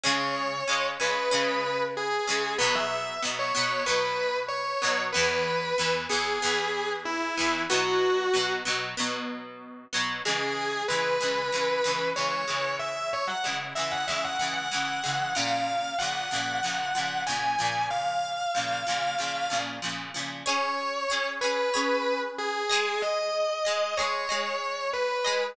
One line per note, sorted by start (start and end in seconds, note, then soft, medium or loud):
0.03 0.62 C#3 loud
0.03 0.62 G#3 loud
0.03 0.62 C#4 loud
0.03 0.85 C#5 medium
0.68 0.97 C#3 medium
0.68 0.97 G#3 loud
0.68 0.97 C#4 loud
1.00 1.29 C#3 medium
1.00 1.29 G#3 medium
1.00 1.29 C#4 medium
1.00 1.80 B4 medium
1.31 2.19 C#3 loud
1.31 2.19 G#3 medium
1.31 2.19 C#4 loud
1.97 2.54 G#4 medium
2.27 2.57 C#3 loud
2.27 2.57 G#3 loud
2.27 2.57 C#4 medium
2.58 3.17 B2 loud
2.58 3.17 F#3 loud
2.58 3.17 B3 loud
2.58 2.73 B4 medium
2.75 3.17 E5 medium
3.22 3.52 B2 medium
3.22 3.52 F#3 medium
3.22 3.52 B3 loud
3.39 3.85 C#5 medium
3.55 3.84 B2 medium
3.55 3.84 F#3 medium
3.55 3.84 B3 loud
3.86 4.74 B2 medium
3.86 4.74 F#3 medium
3.86 4.74 B3 medium
3.86 4.37 B4 medium
4.48 5.02 C#5 medium
4.82 5.11 B2 loud
4.82 5.11 F#3 loud
4.82 5.11 B3 medium
5.13 5.73 E3 loud
5.13 5.73 B3 loud
5.13 5.92 B4 medium
5.17 5.73 E2 loud
5.78 6.07 E2 medium
5.78 6.07 E3 medium
5.78 6.07 B3 medium
6.09 6.39 E2 medium
6.09 6.39 E3 medium
6.09 6.39 B3 loud
6.09 6.91 G#4 medium
6.42 7.30 E2 loud
6.42 7.30 E3 medium
6.42 7.30 B3 loud
7.05 7.60 E4 medium
7.37 7.67 E2 medium
7.37 7.67 E3 loud
7.37 7.67 B3 loud
7.70 8.28 B2 loud
7.70 8.28 F#3 loud
7.70 8.28 B3 loud
7.70 8.52 F#4 medium
8.34 8.63 B2 loud
8.34 8.63 F#3 medium
8.34 8.63 B3 medium
8.65 8.95 B2 loud
8.65 8.95 F#3 loud
8.65 8.95 B3 medium
8.97 9.85 B2 loud
8.97 9.85 F#3 loud
8.97 9.85 B3 medium
9.93 10.22 B2 medium
9.93 10.22 F#3 loud
9.93 10.22 B3 loud
10.25 10.84 C#3 medium
10.25 10.84 E3 medium
10.25 10.84 G#3 loud
10.25 10.83 G#4 medium
10.88 11.18 C#3 medium
10.88 11.18 E3 medium
10.88 11.18 G#3 medium
10.88 12.07 B4 medium
11.20 11.50 C#3 medium
11.20 11.50 E3 medium
11.20 11.50 G#3 medium
11.52 11.82 C#3 medium
11.52 11.82 E3 medium
11.52 11.82 G#3 medium
11.84 12.13 C#3 medium
11.84 12.13 E3 medium
11.84 12.13 G#3 medium
12.16 12.45 C#3 medium
12.16 12.45 E3 medium
12.16 12.45 G#3 medium
12.16 12.74 C#5 medium
12.48 13.36 C#3 medium
12.48 13.36 E3 medium
12.48 13.36 G#3 medium
12.79 13.07 E5 medium
13.13 13.28 C#5 medium
13.27 13.54 F#5 medium
13.44 13.73 C#3 medium
13.44 13.73 E3 medium
13.44 13.73 G#3 medium
13.75 14.05 C#3 medium
13.75 14.05 E3 medium
13.75 14.05 G#3 medium
13.75 13.90 E5 medium
13.92 14.07 F#5 medium
14.07 14.37 C#3 medium
14.07 14.37 E3 medium
14.07 14.37 G#3 medium
14.07 14.22 E5 medium
14.24 14.39 F#5 medium
14.39 14.69 C#3 medium
14.39 14.69 E3 medium
14.39 14.69 G#3 medium
14.39 14.53 F#5 medium
14.54 15.31 F#5 medium
14.71 15.01 C#3 medium
14.71 15.01 E3 medium
14.71 15.01 G#3 medium
15.03 15.33 C#3 medium
15.03 15.33 E3 medium
15.03 15.33 G#3 medium
15.35 15.94 A#2 medium
15.35 15.94 C#3 medium
15.35 15.94 F3 medium
15.35 15.96 F5 medium
15.99 16.29 A#2 medium
15.99 16.29 C#3 medium
15.99 16.29 F3 medium
15.99 17.20 F#5 medium
16.31 16.60 A#2 medium
16.31 16.60 C#3 medium
16.31 16.60 F3 medium
16.63 16.92 A#2 medium
16.63 16.92 C#3 medium
16.63 16.92 F3 medium
16.95 17.24 A#2 medium
16.95 17.24 C#3 medium
16.95 17.24 F3 medium
17.26 17.56 A#2 medium
17.26 17.56 C#3 medium
17.26 17.56 F3 medium
17.26 17.84 G#5 medium
17.59 18.47 A#2 medium
17.59 18.47 C#3 medium
17.59 18.47 F3 medium
17.91 19.54 F5 medium
18.55 18.84 A#2 medium
18.55 18.84 C#3 medium
18.55 18.84 F3 medium
18.87 19.16 A#2 medium
18.87 19.16 C#3 medium
18.87 19.16 F3 medium
19.18 19.48 A#2 medium
19.18 19.48 C#3 medium
19.18 19.48 F3 medium
19.50 19.79 A#2 medium
19.50 19.79 C#3 medium
19.50 19.79 F3 medium
19.82 20.12 A#2 medium
19.82 20.12 C#3 medium
19.82 20.12 F3 medium
20.14 20.44 A#2 medium
20.14 20.44 C#3 medium
20.14 20.44 F3 medium
20.46 21.05 C#4 loud
20.46 21.05 G#4 loud
20.46 21.05 C#5 loud
20.46 21.26 C#5 medium
21.10 21.39 C#4 medium
21.10 21.39 G#4 loud
21.10 21.39 C#5 loud
21.41 21.71 C#4 medium
21.41 21.71 G#4 medium
21.41 22.19 B4 medium
21.41 21.71 C#5 medium
21.74 22.62 C#4 loud
21.74 22.62 G#4 loud
21.74 22.62 C#5 loud
22.38 23.01 G#4 medium
22.69 23.60 G#3 loud
22.69 23.60 G#4 loud
22.69 23.60 D#5 loud
23.02 23.95 D#5 medium
23.65 23.94 G#3 medium
23.65 23.94 G#4 loud
23.65 23.94 D#5 medium
23.97 24.27 G#3 medium
23.97 24.27 G#4 medium
23.97 24.88 C#5 medium
23.97 24.27 D#5 loud
24.29 25.17 G#3 medium
24.29 25.17 G#4 medium
24.29 25.17 D#5 medium
24.93 25.45 B4 medium
25.24 25.54 G#3 loud
25.24 25.54 G#4 medium
25.24 25.54 D#5 loud